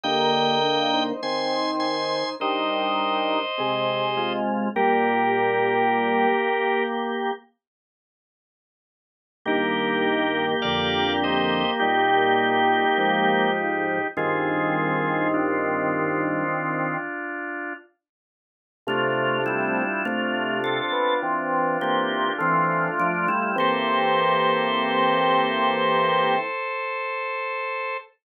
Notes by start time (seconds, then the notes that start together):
0.04 D3 A#3 G4 D#5 G5
0.63 D4 A#4
0.93 D#4 C5
1.23 D#3 C4 D#4 C5 G#5 C6
1.80 G#5 C6
2.40 G3 D4 D#4 A#4 C5 D#5
3.58 C3 G#3 C4 G#4
4.17 G#3 F4
4.75 A#2 G3 A#3 G4 A#4
9.46 G2 D#3 A#3 G4 A#4
10.62 F2 D3 D5 F5
11.24 C5 D#5
11.80 A#2 G3 D#4 G4
12.98 G#2 F3
14.17 G2 D#3 C4 F4 G#4
15.34 D4 F4
18.87 C3 A3 D4 F4
19.46 G3 E4
20.05 C3 A3 F4
20.64 C4 A4
20.92 B3
21.22 E3 C4
21.81 E3 A#3 C4 G4
22.38 E3 A3 C4 F4
23.00 F3 D4
23.28 G3 E4
23.56 E3 A#3 C4 G4 A4 C5